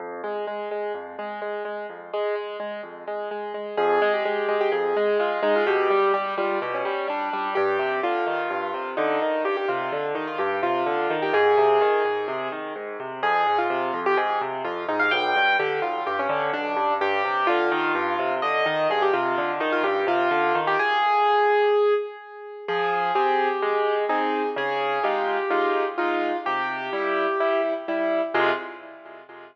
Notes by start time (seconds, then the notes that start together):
0.00 F2
0.24 G#3
0.47 G#3
0.71 G#3
0.94 F2
1.19 G#3
1.42 G#3
1.65 G#3
1.89 F2
2.13 G#3
2.35 G#3
2.60 G#3
2.83 F2
3.07 G#3
3.31 G#3
3.54 G#3
3.77 F2 G#4
4.02 G#3
4.14 G4
4.25 G#3
4.48 G#3
4.61 G4
4.72 F2 G#4
4.97 G#3
5.19 G#3 F4
5.42 G#3 D#4
5.56 F4
5.67 B2 G4
5.90 G3
6.14 G3 G4
6.38 G3 F4
6.62 B2 G4
6.74 C#4
6.85 G3
7.08 G3 D4
7.33 G3
7.55 G2 G4
7.79 C3
8.03 D3 F4
8.27 D#3
8.50 G2
8.74 C3
8.97 D3 D#4
9.22 D#3
9.44 G2 G4
9.57 G4
9.68 C3 F4
9.92 D3
10.15 D#3 D#4
10.27 F4
10.38 G2 G4
10.62 C3 F4
10.86 D3
11.10 D#3
11.22 G4
11.33 G#2 G#4
11.57 C3
11.81 D#3
12.05 G#2
12.28 C3
12.52 D#3
12.76 G#2
13.00 C3
13.23 F2 G#4
13.47 G#2
13.58 F4
13.70 C3
13.94 F2
14.06 G4
14.17 G#2 G#4
14.41 C3
14.64 F2 F4
14.88 G#2 D#4
14.99 F5
15.11 B1 G5
15.36 G2
15.59 D3 G4
15.82 B1 F4
16.06 G2 G4
16.19 C#4
16.29 D3
16.53 B1 D4
16.76 G2
17.01 G2 G4
17.25 C3
17.47 D3 F4
17.71 D#3
17.95 G2
18.19 C3
18.42 D3 D#5
18.66 D#3
18.90 G2 G#4
19.02 G4
19.13 C3 F4
19.38 D3
19.60 D#3 D#4
19.72 F4
19.83 G2 G4
20.07 C3 F4
20.31 D3
20.55 D#3
20.67 G4
20.79 G#4
22.68 F3 G#4
23.15 C4 G4 G#4
23.62 G#3
24.09 C4 D#4 G#4
24.56 C#3 G#4
25.04 G#3 D#4 F4 G4
25.50 G#3 D#4 F4
25.98 G#3 D#4 F4
26.46 C3 G4
26.93 G3 E4
27.40 G3 E4
27.88 G3 E4
28.34 F2 C3 G#3 F4